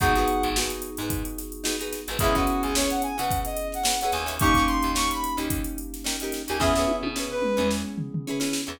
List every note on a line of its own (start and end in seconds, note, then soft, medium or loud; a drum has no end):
0.00 0.25 G#1 loud
0.00 2.17 B3 medium
0.00 0.13 D#4 loud
0.00 2.17 D#4 medium
0.00 2.17 F#4 medium
0.00 0.13 F#4 medium
0.00 2.17 G#4 medium
0.00 0.13 G#4 medium
0.00 0.13 B4 medium
0.00 0.48 F#5 loud
0.00 kick loud
0.00 closed hi-hat medium
0.15 0.48 D#4 medium
0.15 0.48 F#4 medium
0.15 0.48 G#4 medium
0.15 0.48 B4 medium
0.15 snare soft
0.15 closed hi-hat medium
0.28 closed hi-hat medium
0.43 0.68 G#1 loud
0.43 closed hi-hat medium
0.56 0.90 D#4 medium
0.56 0.90 F#4 medium
0.56 0.90 G#4 medium
0.56 0.90 B4 medium
0.56 snare loud
0.70 closed hi-hat medium
0.82 closed hi-hat medium
0.97 1.23 G#2 loud
0.97 1.42 D#4 medium
0.97 1.42 F#4 medium
0.97 1.42 G#4 medium
0.97 closed hi-hat medium
1.02 1.42 B4 medium
1.10 kick medium
1.10 closed hi-hat medium
1.25 closed hi-hat medium
1.38 snare soft
1.38 closed hi-hat medium
1.52 closed hi-hat medium
1.64 1.76 D#4 medium
1.64 1.76 F#4 medium
1.64 1.76 G#4 medium
1.64 1.76 B4 medium
1.64 snare loud
1.79 2.01 D#4 medium
1.79 2.01 F#4 medium
1.79 2.01 G#4 medium
1.79 2.01 B4 medium
1.79 closed hi-hat medium
1.93 snare medium
1.93 closed hi-hat medium
2.08 2.19 G#1 medium
2.08 2.18 D#4 medium
2.08 2.18 F#4 medium
2.08 2.18 G#4 medium
2.08 2.18 B4 medium
2.08 snare soft
2.08 closed hi-hat medium
2.19 2.45 C#2 loud
2.19 4.36 B3 medium
2.19 4.36 C#4 medium
2.19 2.33 C#4 medium
2.19 4.36 E4 medium
2.19 2.35 E4 medium
2.19 2.33 E4 medium
2.19 4.36 G#4 loud
2.19 2.33 G#4 medium
2.19 kick loud
2.19 closed hi-hat loud
2.24 2.33 B4 loud
2.35 2.67 C#4 medium
2.35 2.67 E4 medium
2.35 2.62 F#4 medium
2.35 2.67 G#4 medium
2.35 2.67 B4 medium
2.35 kick medium
2.35 closed hi-hat medium
2.47 closed hi-hat medium
2.63 2.88 C#2 medium
2.63 2.74 G#4 medium
2.63 closed hi-hat medium
2.75 3.10 C#4 medium
2.75 3.10 E4 medium
2.75 3.10 G#4 medium
2.75 2.90 C#5 medium
2.75 snare loud
2.79 3.10 B4 medium
2.90 3.02 F#5 medium
2.90 snare soft
2.90 closed hi-hat medium
3.02 3.17 G#5 medium
3.02 closed hi-hat medium
3.17 3.44 C#3 medium
3.17 3.61 C#4 medium
3.17 3.61 E4 medium
3.17 3.61 G#4 medium
3.17 3.61 B4 medium
3.17 3.39 F#5 medium
3.17 closed hi-hat medium
3.31 kick medium
3.31 closed hi-hat medium
3.45 3.68 D#5 medium
3.45 closed hi-hat medium
3.57 closed hi-hat medium
3.72 3.99 F#5 medium
3.72 snare soft
3.72 closed hi-hat medium
3.83 3.96 C#4 medium
3.83 3.96 E4 medium
3.83 3.96 G#4 medium
3.83 3.96 B4 medium
3.83 snare loud
4.00 4.24 C#4 medium
4.00 4.24 E4 medium
4.00 4.12 F#5 medium
4.00 closed hi-hat medium
4.04 4.24 G#4 medium
4.04 4.24 B4 medium
4.12 4.65 D#2 loud
4.12 4.27 G#5 medium
4.12 snare medium
4.12 closed hi-hat medium
4.26 4.36 C#4 medium
4.26 4.36 E4 medium
4.26 4.36 G#4 medium
4.26 4.36 B4 medium
4.26 snare soft
4.26 closed hi-hat medium
4.39 6.57 A#3 loud
4.39 4.53 C#4 medium
4.39 6.57 C#4 medium
4.39 6.57 D#4 medium
4.39 4.53 D#4 loud
4.39 6.57 G4 medium
4.39 4.53 G4 medium
4.39 4.63 C#6 loud
4.39 kick loud
4.39 closed hi-hat loud
4.44 4.53 A#4 medium
4.54 4.89 C#4 medium
4.54 4.89 D#4 medium
4.54 kick medium
4.54 closed hi-hat medium
4.58 4.89 G4 medium
4.58 4.89 A#4 medium
4.67 4.91 C6 medium
4.67 closed hi-hat medium
4.83 5.08 D#2 medium
4.83 closed hi-hat medium
4.95 5.29 C#4 medium
4.95 5.29 D#4 medium
4.95 5.29 G4 medium
4.95 5.29 A#4 medium
4.95 5.10 C#6 medium
4.95 snare loud
5.11 5.34 B5 medium
5.11 closed hi-hat medium
5.24 closed hi-hat medium
5.37 5.62 D#2 medium
5.37 5.80 C#4 medium
5.37 5.80 D#4 medium
5.37 5.80 G4 medium
5.37 5.80 A#4 medium
5.37 closed hi-hat medium
5.50 kick medium
5.50 closed hi-hat loud
5.64 closed hi-hat medium
5.78 closed hi-hat medium
5.94 snare soft
5.94 closed hi-hat medium
6.04 6.16 C#4 medium
6.04 6.16 D#4 medium
6.04 6.16 G4 medium
6.04 6.16 A#4 medium
6.04 snare loud
6.20 6.42 C#4 medium
6.20 6.42 D#4 medium
6.20 6.42 G4 medium
6.20 closed hi-hat medium
6.24 6.42 A#4 medium
6.32 snare medium
6.32 closed hi-hat medium
6.48 6.61 D#2 medium
6.48 6.58 C#4 medium
6.48 6.58 D#4 medium
6.48 6.58 G4 medium
6.48 6.58 A#4 medium
6.48 6.61 G#5 medium
6.48 closed hi-hat medium
6.60 6.85 E2 loud
6.60 8.76 B3 medium
6.60 6.72 C#4 medium
6.60 8.76 C#4 medium
6.60 8.76 E4 medium
6.60 6.72 E4 medium
6.60 8.76 G#4 medium
6.60 6.72 G#4 medium
6.60 6.72 B4 medium
6.60 6.96 E5 medium
6.60 kick medium
6.60 snare medium
6.75 7.09 C#4 medium
6.75 7.09 E4 medium
6.75 7.09 G#4 medium
6.75 7.09 B4 medium
6.75 snare medium
6.88 high tom medium
7.03 7.27 B2 medium
7.03 high tom medium
7.16 7.50 C#4 medium
7.16 7.50 E4 medium
7.16 7.50 G#4 medium
7.16 7.50 B4 medium
7.16 snare medium
7.31 7.68 B4 medium
7.42 mid tom medium
7.57 7.82 E2 medium
7.57 8.00 C#4 medium
7.57 8.00 E4 medium
7.57 8.00 G#4 medium
7.57 8.00 B4 medium
7.57 mid tom medium
7.71 snare medium
7.98 floor tom medium
8.14 floor tom medium
8.27 8.39 C#4 medium
8.27 8.39 E4 medium
8.27 8.39 G#4 medium
8.27 8.39 B4 medium
8.40 8.61 C#4 medium
8.40 8.61 E4 medium
8.40 8.61 G#4 medium
8.40 8.61 B4 medium
8.40 snare medium
8.53 snare medium
8.67 8.79 E2 loud
8.67 8.77 C#4 medium
8.67 8.77 E4 medium
8.67 8.77 G#4 medium
8.67 8.77 B4 medium